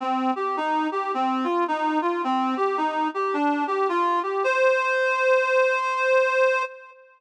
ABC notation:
X:1
M:4/4
L:1/8
Q:"Swing" 1/4=108
K:Cm
V:1 name="Clarinet"
C G E G C F E F | C G E G D G F G | c8 |]